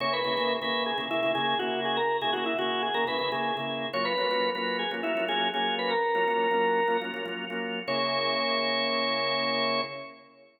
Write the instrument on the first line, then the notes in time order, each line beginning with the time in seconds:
drawbar organ
0.00 C#3 A#3 E4 G#4 C#5
0.13 B4
0.24 C#3 A#3 E4 G#4
0.37 C#3 A#3 E4 G#4
0.62 C#3 A#3 E4 G#4 B4
0.86 G#4
0.98 C#3 A#3 E4 G#4
1.10 C#3 A#3 E4 G#4
1.23 C#3 A#3 E4 G#4
1.35 C#3 A#3 E4 G#4
1.59 C#3 A#3 E4 F#4 G#4
1.85 G#4
1.97 A#4
2.21 C#3 A#3 E4 G#4
2.33 C#3 A#3 E4 F#4 G#4
2.46 E4
2.59 C#3 A#3 E4 F#4 G#4
2.83 G#4
2.94 C#3 A#3 E4 G#4 A#4
3.07 C#3 A#3 E4 G#4 B4
3.19 C#3 A#3 E4 G#4
3.32 C#3 A#3 E4 G#4
3.57 C#3 A#3 E4 G#4
3.93 F#3 A#3 C#4 F4 C#5
4.05 B4
4.18 F#3 A#3 C#4 F4
4.31 F#3 A#3 C#4 F4
4.55 F#3 A#3 C#4 F4 B4
4.79 G#4
4.91 F#3 A#3 C#4 F4
5.03 F#3 A#3 C#4 E4 F4
5.17 F#3 A#3 C#4 F4
5.28 F#3 A#3 C#4 F4 G#4
5.54 F#3 A#3 C#4 F4 G#4
5.79 B4
5.91 A#4
6.15 F#3 A#3 C#4 F4
6.28 F#3 A#3 C#4 F4
6.51 F#3 A#3 C#4 F4
6.88 F#3 A#3 C#4 F4
7.01 F#3 A#3 C#4 F4
7.14 F#3 A#3 C#4 F4
7.26 F#3 A#3 C#4 F4
7.50 F#3 A#3 C#4 F4
7.87 C#3 A#3 E4 G#4 C#5